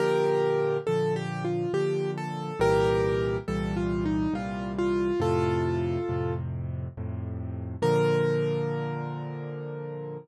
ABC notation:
X:1
M:3/4
L:1/8
Q:1/4=69
K:Bb
V:1 name="Acoustic Grand Piano"
[GB]2 (3A G F G A | [GB]2 (3A F E F F | [FA]3 z3 | B6 |]
V:2 name="Acoustic Grand Piano" clef=bass
[B,,D,F,]2 [B,,D,F,]2 [B,,D,F,]2 | [C,,B,,=E,G,]2 [C,,B,,E,G,]2 [C,,B,,E,G,]2 | [F,,A,,C,]2 [F,,A,,C,]2 [F,,A,,C,]2 | [B,,D,F,]6 |]